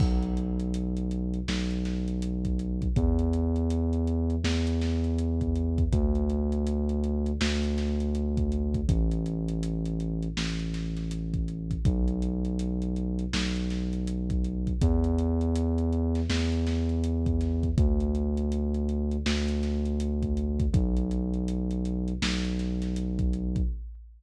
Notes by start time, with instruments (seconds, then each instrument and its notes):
0.00 synth bass 2 B1, kick, crash
0.23 closed hi-hat
0.37 closed hi-hat
0.60 closed hi-hat
0.74 closed hi-hat
0.97 closed hi-hat
1.11 closed hi-hat
1.34 closed hi-hat
1.48 synth bass 2 B1, snare
1.71 closed hi-hat
1.85 snare, closed hi-hat
2.08 closed hi-hat
2.22 closed hi-hat
2.45 kick, closed hi-hat
2.59 closed hi-hat
2.82 kick, closed hi-hat
2.96 synth bass 2 E2, kick, closed hi-hat
3.19 closed hi-hat
3.33 closed hi-hat
3.56 closed hi-hat
3.70 closed hi-hat
3.93 closed hi-hat
4.07 closed hi-hat
4.30 closed hi-hat
4.44 synth bass 2 E2, snare
4.67 closed hi-hat
4.81 snare, closed hi-hat
5.04 closed hi-hat
5.19 closed hi-hat
5.41 kick, closed hi-hat
5.56 closed hi-hat
5.78 kick, closed hi-hat
5.93 synth bass 2 D2, kick, closed hi-hat
6.15 closed hi-hat
6.30 closed hi-hat
6.52 closed hi-hat
6.67 closed hi-hat
6.89 closed hi-hat
7.04 closed hi-hat
7.26 closed hi-hat
7.41 synth bass 2 D2, snare
7.63 closed hi-hat
7.78 snare, closed hi-hat
8.00 closed hi-hat
8.15 closed hi-hat
8.37 kick, closed hi-hat
8.52 closed hi-hat
8.74 kick, closed hi-hat
8.89 synth bass 2 A1, kick, closed hi-hat
9.11 closed hi-hat
9.26 closed hi-hat
9.48 closed hi-hat
9.63 closed hi-hat
9.85 closed hi-hat
10.00 closed hi-hat
10.23 closed hi-hat
10.37 synth bass 2 A1, snare
10.60 closed hi-hat
10.74 snare, closed hi-hat
10.97 snare, closed hi-hat
11.11 closed hi-hat
11.34 kick, closed hi-hat
11.48 closed hi-hat
11.71 kick, closed hi-hat
11.85 synth bass 2 B1, kick, closed hi-hat
12.08 closed hi-hat
12.22 closed hi-hat
12.45 closed hi-hat
12.59 closed hi-hat
12.82 closed hi-hat
12.96 closed hi-hat
13.19 closed hi-hat
13.33 synth bass 2 B1, snare
13.56 closed hi-hat
13.70 snare, closed hi-hat
13.93 closed hi-hat
14.07 closed hi-hat
14.30 kick, closed hi-hat
14.44 closed hi-hat
14.67 kick, closed hi-hat
14.81 synth bass 2 E2, kick, closed hi-hat
15.04 closed hi-hat
15.19 closed hi-hat
15.41 closed hi-hat
15.56 closed hi-hat
15.78 closed hi-hat
15.93 closed hi-hat
16.15 snare, closed hi-hat
16.29 synth bass 2 E2, snare
16.52 closed hi-hat
16.67 snare, closed hi-hat
16.89 closed hi-hat
17.04 closed hi-hat
17.26 kick, closed hi-hat
17.41 snare, closed hi-hat
17.63 kick, closed hi-hat
17.78 synth bass 2 D2, kick, closed hi-hat
18.00 closed hi-hat
18.15 closed hi-hat
18.37 closed hi-hat
18.52 closed hi-hat
18.74 closed hi-hat
18.89 closed hi-hat
19.11 closed hi-hat
19.26 synth bass 2 D2, snare
19.48 closed hi-hat
19.63 snare, closed hi-hat
19.85 closed hi-hat
20.00 closed hi-hat
20.23 kick, closed hi-hat
20.37 closed hi-hat
20.60 kick, closed hi-hat
20.74 synth bass 2 B1, kick, closed hi-hat
20.97 closed hi-hat
21.11 closed hi-hat
21.34 closed hi-hat
21.48 closed hi-hat
21.71 closed hi-hat
21.85 closed hi-hat
22.08 closed hi-hat
22.22 synth bass 2 B1, snare
22.45 closed hi-hat
22.59 snare, closed hi-hat
22.82 snare, closed hi-hat
22.96 closed hi-hat
23.19 kick, closed hi-hat
23.33 closed hi-hat
23.56 kick, closed hi-hat